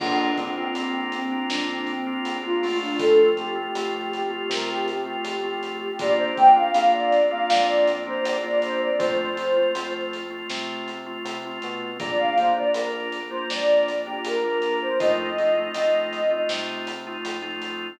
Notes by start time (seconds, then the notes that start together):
0.00 A#1 A#3 C4 D4 F4, kick, crash
0.36 A#3 C4 D4 F4, kick, closed hi-hat
0.57 A#3 C4 D4 F4
0.74 A#1 A#3 C4 D4 F4, closed hi-hat
1.12 C4, closed hi-hat
1.32 A#3 C4 D4 F4
1.50 F2 D4, snare
1.69 C4
1.87 C4, closed hi-hat
2.07 A#3 C4 D4 F4
2.25 A#1, closed hi-hat
2.43 A#3 C4 D4 F4
2.63 A3 C4 F4, open hi-hat
2.82 D4
2.99 F2 A4, kick, closed hi-hat
3.37 A3 C4 F4 G4, closed hi-hat
3.55 A3 C4 F4
3.75 F2 A3 C4 F4, closed hi-hat
4.12 G4, closed hi-hat
4.30 A3 C4 F4
4.49 C3 A#4, snare
4.69 G4
4.88 G4, closed hi-hat
5.06 A3 C4 F4
5.24 F2, closed hi-hat
5.43 A3 C4 F4 G4
5.63 closed hi-hat
5.81 G4
5.99 A#1 A#3 C4 D4 F4 D5, kick, closed hi-hat
6.18 C5
6.37 A#3 C4 D4 F4 G5, kick, closed hi-hat
6.56 A#3 C4 D4 F4 F5
6.74 A#1 A#3 C4 D4 F4 F5, closed hi-hat
6.93 D5
7.12 closed hi-hat
7.31 A#3 C4 D4 F4 F5
7.50 F2 D5, snare
7.87 closed hi-hat
8.07 A#3 C4 D4 F4 C5
8.23 A#1 D5, closed hi-hat
8.43 A#3 C4 D4 F4
8.62 C5, closed hi-hat
8.83 D5
8.99 F2 A3 C4 F4 C5, kick, closed hi-hat
9.37 A3 C4 F4, closed hi-hat
9.56 A3 C4 F4
9.75 F2 A3 C4 F4, closed hi-hat
10.13 closed hi-hat
10.30 A3 C4 F4
10.50 C3, snare
10.88 closed hi-hat
11.06 A3 C4 F4
11.25 C3, closed hi-hat
11.45 A3 C4 F4
11.62 B2, closed hi-hat
12.00 A#1 A#3 D4 F4 D5, kick, closed hi-hat
12.19 F5
12.36 A#3 D4 F4 C5, kick, closed hi-hat
12.57 A#3 D4 F4 D5
12.73 A#1 A#3 D4 F4 A#4, closed hi-hat
13.12 closed hi-hat
13.29 A#3 D4 F4 C5
13.49 F2 D5, snare
13.88 closed hi-hat
14.06 A#3 D4 F4 G4
14.24 A#1 A#4, closed hi-hat
14.44 A#3 D4 F4
14.62 A#4, closed hi-hat
14.81 C5
15.00 F2 A3 C4 D#4 F4 D#5, kick, closed hi-hat
15.38 A3 C4 D#4 F4, closed hi-hat
15.57 A3 C4 D#4 F4
15.74 F2 A3 C4 D#4 F4, closed hi-hat
16.13 closed hi-hat
16.31 A3 C4 D#4 F4
16.49 C3, snare
16.87 closed hi-hat
17.07 A3 C4 D#4 F4
17.25 F2, closed hi-hat
17.42 A3 C4 D#4 F4
17.62 closed hi-hat